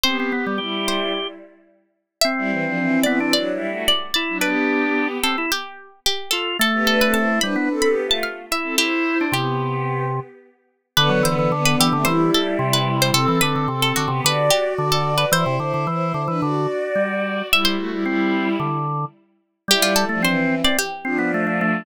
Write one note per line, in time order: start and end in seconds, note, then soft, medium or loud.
0.04 0.31 B3 medium
0.04 0.17 C4 loud
0.04 0.31 G4 medium
0.04 0.79 C5 medium
0.20 0.33 C4 medium
0.32 0.55 B3 soft
0.32 0.45 B3 medium
0.32 0.55 G4 medium
0.46 0.59 G3 medium
0.58 1.10 G3 medium
0.58 1.10 E4 medium
0.58 1.27 G4 medium
0.88 1.68 C5 medium
2.21 3.00 C4 loud
2.21 2.92 E5 medium
2.38 2.50 G3 medium
2.38 2.50 E4 medium
2.51 2.64 E3 medium
2.51 2.64 C4 medium
2.65 2.78 F3 medium
2.65 2.78 D4 medium
2.78 3.02 E3 medium
2.78 3.02 C4 medium
3.03 3.19 E3 medium
3.03 3.19 B3 loud
3.03 3.19 C4 medium
3.03 3.26 D5 medium
3.20 3.33 E3 medium
3.20 3.33 C4 medium
3.20 3.33 D4 medium
3.33 3.52 F#3 medium
3.33 3.52 D4 medium
3.33 3.83 D5 medium
3.52 3.70 G3 medium
3.52 3.70 E4 medium
3.69 3.86 A3 medium
3.69 3.86 F#4 medium
3.88 4.14 D5 medium
4.14 4.38 E4 medium
4.14 4.39 D5 medium
4.29 4.42 F#3 medium
4.29 4.42 D4 medium
4.41 5.18 B3 medium
4.41 5.08 D4 loud
4.41 5.18 G4 medium
4.41 5.07 B4 medium
5.23 5.36 C4 medium
5.23 5.46 A4 medium
5.38 5.51 E4 medium
5.52 6.00 G4 medium
6.06 6.31 G4 medium
6.31 6.57 F4 medium
6.31 6.56 A4 medium
6.59 7.39 A3 loud
6.59 6.84 A4 medium
6.73 6.86 B3 medium
6.73 6.86 G4 medium
6.87 7.00 D4 medium
6.87 7.00 A4 medium
6.87 7.00 B4 medium
7.01 7.16 C4 medium
7.01 7.16 A4 medium
7.01 7.14 B4 medium
7.14 7.40 E4 medium
7.14 7.40 C5 medium
7.14 7.39 A5 medium
7.41 7.56 G3 medium
7.41 7.54 D4 medium
7.41 7.54 B4 medium
7.41 7.81 B5 medium
7.56 7.69 B3 medium
7.56 7.69 D4 medium
7.56 7.69 B4 medium
7.70 7.88 C4 medium
7.70 7.88 A4 medium
7.82 7.95 B5 medium
7.86 8.04 B3 medium
7.86 8.04 G4 medium
8.06 8.23 A3 medium
8.06 8.23 F4 medium
8.11 8.24 A5 medium
8.23 8.45 F5 medium
8.51 8.75 E4 medium
8.51 8.79 E5 medium
8.63 8.76 C4 medium
8.63 8.76 A4 medium
8.78 9.18 E4 medium
8.78 9.24 E4 medium
8.78 9.22 G4 medium
8.78 9.24 C5 medium
9.21 9.34 D4 medium
9.32 10.20 C3 medium
9.32 10.04 B3 medium
9.32 10.04 G4 medium
9.32 10.31 G4 medium
10.97 11.10 D3 loud
10.97 11.23 D3 medium
10.97 11.23 B3 medium
10.97 11.21 B4 medium
11.09 11.22 F#3 loud
11.23 11.49 D3 medium
11.23 11.36 E3 medium
11.23 11.49 B3 medium
11.23 11.49 C5 medium
11.39 11.52 E3 medium
11.51 11.87 D3 medium
11.51 11.76 D3 loud
11.51 11.87 B3 medium
11.65 11.78 B4 medium
11.80 11.93 E3 loud
11.80 12.07 G4 medium
11.93 12.07 C3 medium
11.93 12.06 D3 loud
11.93 12.07 A3 medium
12.05 12.30 E3 medium
12.05 13.09 G3 medium
12.05 13.09 E4 medium
12.05 12.27 C5 medium
12.34 12.57 A4 medium
12.59 13.11 C3 loud
12.73 13.00 B4 medium
13.02 13.15 C5 medium
13.14 13.26 C3 loud
13.14 13.38 C4 medium
13.14 13.38 A4 medium
13.14 13.36 A4 medium
13.28 13.41 E3 loud
13.41 13.55 D3 medium
13.41 13.65 C4 medium
13.41 13.65 A4 medium
13.41 13.67 B4 medium
13.56 13.69 D3 medium
13.68 13.93 C3 medium
13.68 14.03 C4 medium
13.68 14.03 A4 medium
13.82 13.95 A4 medium
13.96 14.10 D3 medium
13.96 14.22 F#4 medium
14.08 14.21 C3 loud
14.08 14.23 B3 medium
14.08 14.23 G4 medium
14.24 14.50 D3 loud
14.24 15.25 F#4 medium
14.24 14.52 B4 medium
14.24 15.25 D5 medium
14.50 14.74 G4 medium
14.78 15.25 D3 loud
14.92 15.14 A4 medium
15.18 15.31 B4 medium
15.32 15.45 E3 loud
15.32 15.55 E4 medium
15.32 17.16 C5 medium
15.32 15.55 C5 medium
15.46 15.59 C3 loud
15.59 15.73 D3 medium
15.59 15.85 E4 medium
15.59 15.85 C5 medium
15.74 15.87 D3 medium
15.87 16.13 E3 medium
15.87 16.21 E4 medium
15.87 16.21 C5 medium
16.14 16.27 D3 medium
16.28 16.41 E3 medium
16.28 16.41 D4 medium
16.28 16.41 B4 medium
16.40 16.67 D3 medium
16.40 17.47 F#4 medium
16.40 17.47 D5 medium
16.95 17.42 G3 medium
17.51 17.76 G3 medium
17.51 17.76 E4 medium
17.51 17.66 E5 medium
17.65 19.19 C5 medium
17.77 17.90 A3 medium
17.77 17.90 F#4 medium
17.91 18.04 G3 medium
17.91 18.04 E4 medium
18.05 18.57 G3 medium
18.05 18.49 C4 medium
18.05 18.57 E4 medium
18.60 19.05 D3 medium
19.68 20.05 G3 loud
19.68 19.93 G3 medium
19.68 19.93 E4 medium
19.68 19.84 G4 medium
19.82 19.95 F4 medium
19.96 20.19 A4 medium
20.09 20.25 F3 medium
20.09 20.22 A3 medium
20.09 20.25 D4 medium
20.22 20.61 E3 medium
20.22 20.55 C4 loud
20.22 20.61 C4 medium
20.22 20.62 C5 medium
20.64 20.77 C4 medium
20.64 20.77 D5 medium
20.79 21.66 G4 medium
21.04 21.83 F3 medium
21.04 21.18 C4 loud
21.04 21.83 D4 medium
21.19 21.31 B3 medium
21.34 21.46 A3 medium
21.47 21.60 A3 medium
21.61 21.84 A3 loud